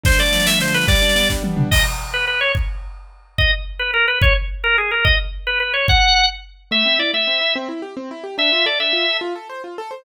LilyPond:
<<
  \new Staff \with { instrumentName = "Drawbar Organ" } { \time 6/8 \key a \minor \tempo 4. = 144 c''8 d''4 e''8 c''8 b'8 | d''4. r4. | \key gis \minor dis''8 r4 b'8 b'8 cis''8 | r2. |
dis''8 r4 b'8 ais'8 b'8 | cis''8 r4 ais'8 gis'8 ais'8 | dis''8 r4 b'8 b'8 cis''8 | fis''4. r4. |
\key a \minor e''4 d''8 e''4. | r2. | e''4 d''8 e''4. | r2. | }
  \new Staff \with { instrumentName = "Acoustic Grand Piano" } { \time 6/8 \key a \minor d8 a8 f8 a8 d8 a8 | g8 d'8 b8 d'8 g8 d'8 | \key gis \minor r2. | r2. |
r2. | r2. | r2. | r2. |
\key a \minor a8 c'8 e'8 a8 c'8 e'8 | c'8 e'8 g'8 c'8 e'8 g'8 | d'8 f'8 a'8 d'8 f'8 a'8 | f'8 a'8 c''8 f'8 a'8 c''8 | }
  \new DrumStaff \with { instrumentName = "Drums" } \drummode { \time 6/8 <bd sn>16 sn16 sn16 sn16 sn16 sn16 sn16 sn16 sn16 sn16 sn16 sn16 | <bd sn>16 sn16 sn16 sn16 sn16 sn16 <bd sn>8 tommh8 toml8 | <cymc bd>4. r4. | bd4. r4. |
bd4. r4. | bd4. r4. | bd4. r4. | bd4. r4. |
r4. r4. | r4. r4. | r4. r4. | r4. r4. | }
>>